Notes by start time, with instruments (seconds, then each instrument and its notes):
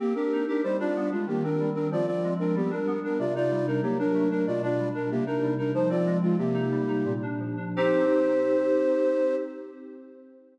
0.00 flute A#3 G4, electric piano 2 C4
0.15 flute D4 A#4, electric piano 2 G4
0.33 electric piano 2 D#4
0.48 flute D4 A#4, electric piano 2 G4
0.63 electric piano 2 G3, flute D#4 C5
0.79 electric piano 2 D4, flute F4 D5
0.96 electric piano 2 B3
1.12 flute G#3 F4, electric piano 2 D4
1.27 electric piano 2 D#3, flute A#3 G4
1.44 electric piano 2 C4, flute D4 A#4
1.60 electric piano 2 G3
1.75 electric piano 2 C4, flute D4 A#4
1.91 electric piano 2 F3, flute F4 D5
2.06 electric piano 2 C4, flute F4 D5
2.23 electric piano 2 G#3
2.39 electric piano 2 C4, flute D4 A#4
2.55 electric piano 2 G3, flute B3 G4
2.71 electric piano 2 D4, flute A#4
2.87 electric piano 2 B3
3.04 electric piano 2 D4, flute A#4
3.19 electric piano 2 C3, flute F4 D5
3.35 electric piano 2 D#4, flute F4 D5
3.51 electric piano 2 G3
3.67 flute D4 A#4, electric piano 2 D#4
3.83 electric piano 2 F#3, flute A#3 G4
3.99 electric piano 2 D4, flute D4 A#4
4.14 electric piano 2 A3
4.31 flute D4 A#4, electric piano 2 D4
4.47 electric piano 2 B2, flute F4 D5
4.62 electric piano 2 D4, flute F4 D5
4.79 electric piano 2 G3
4.95 electric piano 2 D4, flute A#4
5.11 electric piano 2 C3, flute A#3 G4
5.26 flute D4 A#4, electric piano 2 D#4
5.42 electric piano 2 G3
5.58 flute D4 A#4, electric piano 2 D#4
5.74 electric piano 2 F3, flute D#4 C5
5.90 electric piano 2 C4, flute F4 D5
6.06 electric piano 2 G#3
6.22 flute G#3 F4, electric piano 2 C4
6.38 electric piano 2 C3, flute A#3 G4
6.54 electric piano 2 D#4
6.71 electric piano 2 G3
6.88 electric piano 2 D#4
7.05 electric piano 2 A#2
7.22 electric piano 2 D4
7.40 electric piano 2 F3
7.57 electric piano 2 D4
7.76 electric piano 2 C4 D#4 G4, flute C5